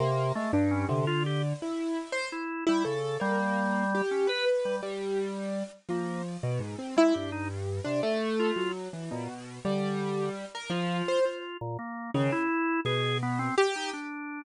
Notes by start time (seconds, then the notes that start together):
0.00 C3 A#3
0.35 G#3 A3
0.53 G2
0.71 C#4
0.89 C3 D3
1.07 F4
1.26 G4
1.62 E4
2.12 C5
2.32 E4
2.67 G3 E4
2.85 C#3 A4
3.20 G3 A#3
3.95 G4
4.11 C#4
4.27 B4
4.65 G3
4.83 G3
5.89 F3 A#3
6.43 B2
6.60 G#2
6.79 C4
6.97 G#3 E4
7.14 G2 G4
7.32 D#4
7.84 C3 D4
8.03 A3
8.39 F4
8.56 F#3
8.93 E3
9.11 A#2 B2
9.65 D3 G3
10.55 A#4
10.70 F3 F4
11.08 C5
11.25 F4
11.61 A#2
11.79 A#3
12.14 C#3 D#3
12.32 E4
12.85 B2 G#4
13.23 B3
13.39 C4
13.58 G4
13.76 D#4
13.93 D4